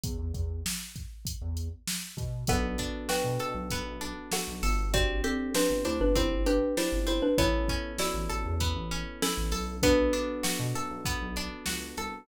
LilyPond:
<<
  \new Staff \with { instrumentName = "Xylophone" } { \time 4/4 \key b \minor \tempo 4 = 98 r1 | <a' fis''>4 <b' g''>2 <a' fis''>4 | <fis' d''>8 <c' a'>8 <d' b'>8 <e' c''>16 <d' b'>16 <e' c''>8 <d' b'>8 <e' c''>8 <e' c''>16 <d' b'>16 | <e' cis''>4 <fis' d''>2 <cis' a'>4 |
<d' b'>2. r4 | }
  \new Staff \with { instrumentName = "Electric Piano 1" } { \time 4/4 \key b \minor r1 | <b d' fis' a'>1 | <c' d' g'>1 | <b cis' e' a'>1 |
<b d' fis' a'>1 | }
  \new Staff \with { instrumentName = "Pizzicato Strings" } { \time 4/4 \key b \minor r1 | b8 d'8 fis'8 a'8 b8 d'8 fis'8 a'8 | c'8 g'8 c'8 d'8 c'8 g'8 d'8 c'8 | b8 cis'8 e'8 a'8 b8 cis'8 e'8 a'8 |
b8 d'8 fis'8 a'8 b8 d'8 fis'8 a'8 | }
  \new Staff \with { instrumentName = "Synth Bass 1" } { \clef bass \time 4/4 \key b \minor e,16 e,16 e,4.~ e,16 e,4~ e,16 b,8 | b,,4~ b,,16 b,16 b,16 b,,8 b,,4 b,,16 g,,8~ | g,,4~ g,,16 g,,16 d,16 g,,8 g,,4 g,,8. | a,,4~ a,,16 a,,16 a,,16 e,8 a,,4 a,,16 b,,8~ |
b,,4~ b,,16 b,16 fis,16 b,,8 b,,8. cis,8 c,8 | }
  \new DrumStaff \with { instrumentName = "Drums" } \drummode { \time 4/4 <hh bd>8 <hh bd>8 sn8 <hh bd>8 <hh bd>8 hh8 sn8 <hh bd>8 | <hh bd>8 <hh bd>8 sn8 hh8 <hh bd>8 hh8 sn8 hho8 | <hh bd>8 hh8 sn8 hh8 <hh bd>8 hh8 sn8 hh8 | <hh bd>8 <hh bd>8 sn8 hh8 <hh bd>8 hh8 sn8 hho8 |
<hh bd>8 hh8 sn8 hh8 <hh bd>8 hh8 sn8 hh8 | }
>>